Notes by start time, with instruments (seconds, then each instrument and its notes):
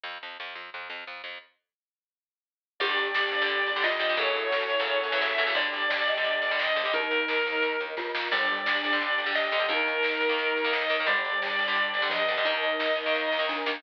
0.04 electric bass (finger) F2
0.23 electric bass (finger) F2
0.40 electric bass (finger) F2
0.55 electric bass (finger) F2
0.74 electric bass (finger) F2
0.90 electric bass (finger) F2
1.07 electric bass (finger) F2
1.24 electric bass (finger) F2
2.79 electric bass (finger) G1, overdriven guitar D3 G3, pad 2 (warm) D4 G4, glockenspiel G4, distortion guitar D5, kick, crash
2.97 electric bass (finger) G1, closed hi-hat
3.15 electric bass (finger) G1, snare
3.32 electric bass (finger) G1, kick, closed hi-hat
3.42 overdriven guitar D3 G3
3.49 electric bass (finger) G1, kick, closed hi-hat
3.66 electric bass (finger) G1, closed hi-hat
3.76 overdriven guitar D3 G3
3.82 electric bass (finger) G1, glockenspiel F4, distortion guitar D#5, snare
3.99 electric bass (finger) G1, overdriven guitar D3 G3, kick, closed hi-hat
4.09 overdriven guitar D3 G3
4.16 electric bass (finger) F#2, overdriven guitar C#3 E3 F#3 A3, pad 2 (warm) C#4 E4 F#4 A4, glockenspiel A4, distortion guitar C#5, kick, closed hi-hat
4.35 electric bass (finger) F#2, closed hi-hat
4.52 electric bass (finger) F#2, snare
4.70 electric bass (finger) F#2, kick, closed hi-hat
4.80 overdriven guitar C#3 E3 F#3 A3
4.87 electric bass (finger) F#2, kick, closed hi-hat
5.04 electric bass (finger) F#2, closed hi-hat
5.12 overdriven guitar C#3 E3 F#3 A3
5.21 electric bass (finger) F#2, distortion guitar E5, snare
5.38 electric bass (finger) F#2, overdriven guitar C#3 E3 F#3 A3, kick, closed hi-hat
5.47 overdriven guitar C#3 E3 F#3 A3
5.54 electric bass (finger) G1, overdriven guitar D3 G3, pad 2 (warm) D4 G4, distortion guitar D5, glockenspiel D5, kick, closed hi-hat
5.73 electric bass (finger) G1, closed hi-hat
5.90 electric bass (finger) G1, glockenspiel D5, snare
6.08 electric bass (finger) G1, glockenspiel D#5, kick, closed hi-hat
6.17 overdriven guitar D3 G3
6.24 electric bass (finger) G1, kick, closed hi-hat
6.42 electric bass (finger) G1, closed hi-hat
6.51 overdriven guitar D3 G3
6.59 electric bass (finger) G1, distortion guitar D#5, snare
6.76 electric bass (finger) G1, overdriven guitar D3 G3, kick, closed hi-hat
6.85 overdriven guitar D3 G3
6.93 electric bass (finger) D#2, glockenspiel D#4, pad 2 (warm) D#4 A#4, distortion guitar A#4, kick, closed hi-hat
7.11 electric bass (finger) D#2, closed hi-hat
7.28 electric bass (finger) D#2, snare
7.45 electric bass (finger) D#2, kick, closed hi-hat
7.62 electric bass (finger) D#2, kick, closed hi-hat
7.80 electric bass (finger) D#2, closed hi-hat
7.97 electric bass (finger) D#2, glockenspiel F4, kick, snare
8.15 electric bass (finger) D#2, snare
8.32 electric bass (finger) G1, overdriven guitar D3 G3, glockenspiel G3, pad 2 (warm) D4 G4, distortion guitar D5, kick, crash
8.47 electric bass (finger) G1, glockenspiel G3, closed hi-hat
8.65 electric bass (finger) G1, glockenspiel D4, snare
8.83 electric bass (finger) G1, kick, closed hi-hat
8.93 overdriven guitar D3 G3
9.01 electric bass (finger) G1, kick, closed hi-hat
9.18 electric bass (finger) G1, closed hi-hat
9.26 overdriven guitar D3 G3
9.35 electric bass (finger) G1, distortion guitar D#5, snare
9.52 electric bass (finger) G1, overdriven guitar D3 G3, kick, closed hi-hat
9.60 overdriven guitar D3 G3
9.69 electric bass (finger) D#2, overdriven guitar D#3 A#3, pad 2 (warm) D#4 A#4, glockenspiel D#4, distortion guitar A#4, kick, closed hi-hat
9.87 electric bass (finger) D#2, closed hi-hat
10.03 electric bass (finger) D#2, snare
10.20 electric bass (finger) D#2, kick, closed hi-hat
10.29 overdriven guitar D#3 A#3
10.38 electric bass (finger) D#2, kick, closed hi-hat
10.56 electric bass (finger) D#2, closed hi-hat
10.65 overdriven guitar D#3 A#3
10.73 electric bass (finger) D#2, distortion guitar D#5, snare
10.90 electric bass (finger) D#2, overdriven guitar D#3 A#3, kick, closed hi-hat
11.00 overdriven guitar D#3 A#3
11.07 electric bass (finger) G1, overdriven guitar D3 G3, glockenspiel G3, pad 2 (warm) D4 G4, distortion guitar D5, kick, closed hi-hat
11.25 electric bass (finger) G1, closed hi-hat
11.42 electric bass (finger) G1, snare
11.59 electric bass (finger) G1, kick, closed hi-hat
11.68 overdriven guitar D3 G3
11.75 electric bass (finger) G1, kick, closed hi-hat
11.94 electric bass (finger) G1, closed hi-hat
12.02 overdriven guitar D3 G3
12.10 electric bass (finger) G1, glockenspiel F3, distortion guitar D#5, snare
12.28 electric bass (finger) G1, overdriven guitar D3 G3, kick, closed hi-hat
12.38 overdriven guitar D3 G3
12.45 electric bass (finger) D#2, overdriven guitar D#3 A#3, glockenspiel D#4, pad 2 (warm) D#4 A#4, distortion guitar D#5, kick, closed hi-hat
12.63 electric bass (finger) D#2, closed hi-hat
12.79 electric bass (finger) D#2, snare
12.96 electric bass (finger) D#2, kick, closed hi-hat
13.06 overdriven guitar D#3 A#3
13.14 electric bass (finger) D#2, kick, snare
13.32 electric bass (finger) D#2, snare
13.39 overdriven guitar D#3 A#3
13.49 electric bass (finger) D#2, glockenspiel D4, snare
13.66 electric bass (finger) D#2, overdriven guitar D#3 A#3, snare
13.74 overdriven guitar D#3 A#3